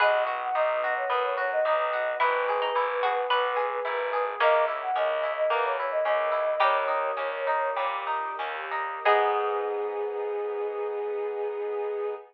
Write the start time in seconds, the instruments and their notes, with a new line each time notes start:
0.00 electric bass (finger) B1, orchestral harp B3, string ensemble 1 B3 D#4 F#4, pizzicato strings G#4 B4, flute D#5
0.26 orchestral harp F#4
0.40 flute F#5
0.55 electric bass (finger) B1, orchestral harp D#4, flute D#5
0.84 orchestral harp F#4
0.96 flute C#5
1.10 electric bass (finger) F#2, orchestral harp B3, string ensemble 1 B3 F#4 B4, flute B4
1.24 flute C#5
1.37 orchestral harp F#4, flute C#5
1.52 flute D#5
1.65 electric bass (finger) B1, orchestral harp D#4, flute D#5
1.93 orchestral harp F#4
2.20 electric bass (finger) G#1, string ensemble 1 B3 E4 G#4, orchestral harp B3, pizzicato strings E4, flute B4
2.49 orchestral harp G#4
2.62 pizzicato strings D#4
2.75 electric bass (finger) G#1, orchestral harp E4
3.03 pizzicato strings F#4, orchestral harp G#4
3.30 electric bass (finger) B1, string ensemble 1 B3 G#4 B4, orchestral harp B3, pizzicato strings B4
3.56 orchestral harp G#4
3.85 electric bass (finger) G#1, orchestral harp E4
4.13 orchestral harp G#4
4.40 electric bass (finger) C#2, string ensemble 1 A#3 C#4 E4, pizzicato strings A#3 C#4, orchestral harp A#3, flute D#5
4.68 orchestral harp E4
4.82 flute F#5
4.96 electric bass (finger) C#2, orchestral harp C#4, flute D#5
5.23 orchestral harp E4
5.37 flute D#5
5.50 electric bass (finger) E2, string ensemble 1 E3 A#3 E4, orchestral harp A#3, flute B4
5.64 flute C#5
5.78 orchestral harp E4, flute C#5
5.91 flute D#5
6.05 electric bass (finger) C#2, orchestral harp C#4, flute D#5
6.32 orchestral harp E4
6.60 electric bass (finger) D#2, orchestral harp G3, string ensemble 1 G3 A#3 C#4 D#4, pizzicato strings D#4 G4, flute C#5
6.88 orchestral harp D#4
7.17 electric bass (finger) D#2, orchestral harp C#4
7.47 orchestral harp D#4
7.76 electric bass (finger) A#2, orchestral harp G3, string ensemble 1 G3 A#3 D#4 G4
8.07 orchestral harp D#4
8.39 electric bass (finger) D#2, orchestral harp C#4
8.71 orchestral harp D#4
9.05 electric bass (finger) G#2, orchestral harp B3 D#4 G#4, string ensemble 1 B3 D#4 G#4, flute G#4, pizzicato strings G#4